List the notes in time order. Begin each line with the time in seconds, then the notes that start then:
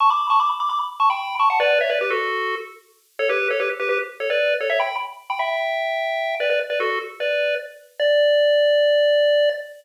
0.00 A5 C#6
0.10 B5 D6
0.30 A5 C#6
0.40 B5 D6
0.60 B5 D6
0.70 B5 D6
1.00 A5 C#6
1.10 G5 B5
1.39 A5 C#6
1.50 F#5 A5
1.60 B4 D5
1.81 C#5 E5
1.90 B4 D5
2.01 G4 B4
2.10 F#4 A4
3.19 A4 C#5
3.29 G4 B4
3.50 A4 C#5
3.60 G4 B4
3.80 G4 B4
3.89 G4 B4
4.20 A4 C#5
4.30 B4 D5
4.61 A4 C#5
4.70 C#5 E5
4.80 G5 B5
5.30 G5 B5
5.39 E5 G5
6.40 B4 D5
6.50 B4 D5
6.70 B4 D5
6.80 F#4 A4
7.20 B4 D5
8.00 D5